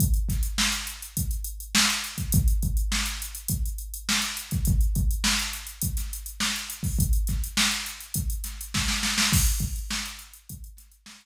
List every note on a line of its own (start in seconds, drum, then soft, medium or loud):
0.00 kick loud
0.00 closed hi-hat loud
0.14 closed hi-hat medium
0.29 kick medium
0.29 snare soft
0.29 closed hi-hat medium
0.43 closed hi-hat medium
0.58 snare loud
0.72 closed hi-hat medium
0.87 closed hi-hat medium
1.02 closed hi-hat medium
1.17 kick medium
1.17 closed hi-hat loud
1.31 closed hi-hat medium
1.44 closed hi-hat medium
1.60 closed hi-hat medium
1.75 snare loud
1.90 closed hi-hat medium
2.04 closed hi-hat medium
2.18 kick medium
2.18 closed hi-hat medium
2.32 kick loud
2.32 closed hi-hat loud
2.48 closed hi-hat medium
2.62 kick medium
2.62 closed hi-hat medium
2.77 closed hi-hat medium
2.92 snare loud
3.06 closed hi-hat medium
3.22 closed hi-hat medium
3.35 closed hi-hat medium
3.48 kick loud
3.48 closed hi-hat loud
3.66 closed hi-hat medium
3.78 closed hi-hat medium
3.94 closed hi-hat medium
4.09 snare loud
4.21 snare soft
4.21 closed hi-hat medium
4.37 closed hi-hat medium
4.51 kick loud
4.51 closed hi-hat medium
4.65 kick loud
4.65 closed hi-hat loud
4.81 closed hi-hat medium
4.95 kick loud
4.95 closed hi-hat medium
5.11 closed hi-hat medium
5.24 snare loud
5.39 closed hi-hat medium
5.53 closed hi-hat medium
5.67 closed hi-hat medium
5.82 kick medium
5.82 closed hi-hat loud
5.97 snare soft
5.97 closed hi-hat medium
6.13 closed hi-hat medium
6.26 closed hi-hat medium
6.40 snare loud
6.56 closed hi-hat medium
6.70 closed hi-hat medium
6.83 kick loud
6.83 open hi-hat medium
6.99 kick loud
6.99 closed hi-hat loud
7.13 closed hi-hat medium
7.27 kick medium
7.27 snare soft
7.27 closed hi-hat medium
7.44 closed hi-hat medium
7.57 snare loud
7.71 closed hi-hat medium
7.86 closed hi-hat medium
8.00 closed hi-hat medium
8.14 kick medium
8.14 closed hi-hat loud
8.30 closed hi-hat medium
8.44 snare soft
8.44 closed hi-hat medium
8.61 closed hi-hat medium
8.74 kick medium
8.74 snare loud
8.88 snare medium
9.03 snare loud
9.18 snare loud
9.33 kick loud
9.33 crash loud
9.46 closed hi-hat medium
9.60 kick loud
9.60 closed hi-hat medium
9.76 closed hi-hat medium
9.91 snare loud
10.06 closed hi-hat medium
10.19 closed hi-hat medium
10.33 closed hi-hat medium
10.49 kick loud
10.49 closed hi-hat loud
10.64 closed hi-hat medium
10.77 snare soft
10.77 closed hi-hat loud
10.92 closed hi-hat medium
11.06 snare loud
11.21 closed hi-hat medium